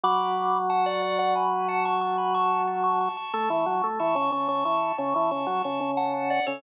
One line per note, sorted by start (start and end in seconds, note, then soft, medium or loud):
0.04 3.09 F#3 loud
0.04 0.58 B5 loud
0.04 0.58 D6 loud
0.70 0.85 F#5 medium
0.70 0.85 A5 loud
0.86 1.02 D5 loud
0.86 1.02 F#5 loud
1.02 1.18 D5 medium
1.02 1.18 F#5 loud
1.19 1.34 D5 loud
1.19 1.34 F#5 loud
1.35 1.67 G#5 medium
1.35 1.67 B5 medium
1.68 1.84 F#5 medium
1.68 1.84 A5 loud
1.85 2.01 A5 medium
1.85 2.01 C#6 loud
2.01 2.17 A5 loud
2.01 2.17 C#6 loud
2.18 2.33 G#5 medium
2.18 2.33 B5 medium
2.34 2.63 A5 loud
2.34 2.63 C#6 loud
2.67 2.83 A5 medium
2.67 2.83 C#6 loud
2.84 2.99 A5 medium
2.84 2.99 C#6 loud
3.01 3.16 A5 medium
3.01 3.16 C#6 loud
3.17 3.33 A5 medium
3.17 3.33 C#6 loud
3.33 3.49 A3 loud
3.33 3.87 A5 loud
3.33 3.87 C#6 loud
3.50 3.66 E3 medium
3.66 3.82 F#3 loud
3.84 3.99 A3 medium
3.99 4.16 E3 loud
3.99 4.15 A5 medium
3.99 4.15 C#6 loud
4.15 4.31 C#3 medium
4.15 4.31 A5 loud
4.15 4.31 C#6 loud
4.32 4.48 C#3 medium
4.32 4.48 A5 medium
4.32 4.48 C#6 medium
4.48 4.64 C#3 medium
4.48 4.64 A5 medium
4.48 4.64 C#6 loud
4.65 4.92 E3 medium
4.65 4.97 A5 medium
4.65 4.97 C#6 medium
4.98 5.14 C#3 loud
4.98 5.14 A5 medium
4.98 5.14 C#6 loud
5.14 5.31 E3 medium
5.14 5.30 A5 medium
5.14 5.30 C#6 loud
5.31 5.47 C#3 medium
5.31 5.47 A5 medium
5.31 5.47 C#6 loud
5.47 5.62 F#3 medium
5.47 5.63 A5 medium
5.47 5.63 C#6 medium
5.64 5.80 C#3 medium
5.64 5.91 A5 medium
5.64 5.91 C#6 loud
5.81 6.40 C#3 loud
5.97 6.13 F#5 medium
5.97 6.13 A5 loud
6.14 6.29 F#5 medium
6.14 6.29 A5 loud
6.30 6.46 D5 medium
6.30 6.46 F#5 loud
6.46 6.62 C#3 loud
6.46 6.62 A4 loud
6.46 6.62 C#5 loud